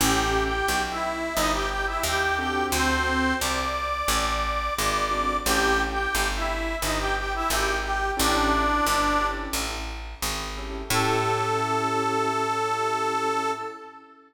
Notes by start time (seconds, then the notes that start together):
0.00 A1 C#4 E4 G4 A4 G5
0.44 G4 G5
0.68 B1
0.91 E4 E5
1.35 G1 D#4 D#5
1.53 G4 G5
1.70 G4 G5
1.87 E4 E5
2.03 D#2 G4 G5
2.38 C4 D4 F#4 G4 A4 G5
2.72 D2 C4 C5
3.41 C2 D5 D6
4.08 A1
4.77 G#1 D5 D6
5.11 C4 D4 F#4 A4
5.45 A1 C#4 E4 G4 A4 G5
5.91 G4 G5
6.15 G1
6.36 E4 E5
6.82 G1 D#4 D#5
6.99 G4 G5
7.17 G4 G5
7.35 E4 E5
7.50 G#1 G4 G5
7.84 G4 G5
8.17 A1 C#4 D4 E4 G4 A4 D5
8.87 G1
9.21 C#4 E4 G4 A4
9.53 A1
10.22 G#1
10.57 C#4 E4 G4 A4
10.90 A2 C#4 E4 G4 A4